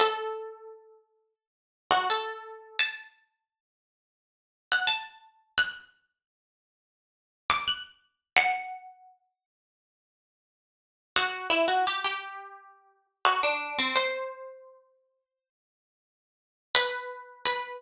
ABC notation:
X:1
M:4/4
L:1/16
Q:1/4=86
K:Em
V:1 name="Harpsichord"
A8 z3 F A4 | a8 z3 f a4 | f'8 z3 d' f'4 | f6 z10 |
F2 E F G G7 F D2 C | c16 | B4 B4 z8 |]